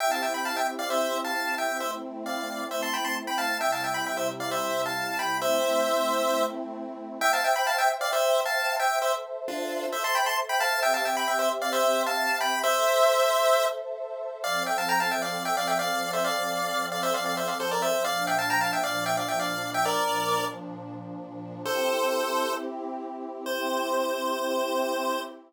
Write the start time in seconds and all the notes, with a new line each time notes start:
0.00 C4 E4 G4 E5 G5
0.11 F5 A5
0.22 E5 G5
0.34 G5 B5
0.45 F5 A5
0.56 E5 G5
0.79 D5 F5
0.90 C5 E5
1.24 F5 A5
1.58 E5 G5
1.80 A3 C4 E4 C5 E5
2.26 D5 F5
2.71 C5 E5
2.82 A5 C6
2.93 G5 B5
3.04 A5 C6
3.27 G5 B5
3.38 F5 A5
3.60 C3 G3 E4 E5 G5
3.72 F5 A5
3.84 E5 G5
3.94 G5 B5
4.06 E5 G5
4.17 C5 E5
4.40 D5 F5
4.51 C5 E5
4.86 F5 A5
5.19 G5 B5
5.41 A3 C4 E4 C5 E5
7.21 C5 E5 G5
7.33 F5 A5
7.44 E5 G5
7.56 G5 B5
7.67 F5 A5
7.78 E5 G5
8.01 D5 F5
8.13 C5 E5
8.45 F5 A5
8.80 E5 G5
9.02 A4 C5 E5
9.48 D4 F4
9.92 C5 E5
10.04 A5 C6
10.15 G5 B5
10.26 A5 C6
10.49 G5 B5
10.60 F5 A5
10.82 C4 G4 E5 G5
10.94 F5 A5
11.05 E5 G5
11.17 G5 B5
11.28 E5 G5
11.39 C5 E5
11.62 D5 F5
11.73 C5 E5
12.06 F5 A5
12.41 G5 B5
12.63 A4 C5 E5
14.43 F3 C4 A4 D5 F5
14.66 E5 G5
14.78 F5 A5
14.89 G5 A#5
15.00 F5 A5
15.11 E5 G5
15.22 D5 F5
15.45 E5 G5
15.57 D5 F5
15.67 E5 G5
15.79 D5 F5
16.13 C5 E5
16.24 D5 F5
16.92 D5 F5
17.03 C5 E5
17.14 D5 F5
17.26 D5 F5
17.37 C5 E5
17.48 D5 F5
17.60 A4 C5
17.71 A#4 D5
17.82 C5 E5
18.04 A#2 F3 D4 D5 F5
18.27 E5 G5
18.39 F5 A5
18.50 G5 A#5
18.61 F5 A5
18.73 E5 G5
18.83 D5 F5
19.06 E5 G5
19.17 D5 F5
19.28 E5 G5
19.39 D5 F5
19.74 E5 G5
19.85 A#4 D5
21.65 C4 E4 G4 A4 C5
23.46 C4 E4 G4 C5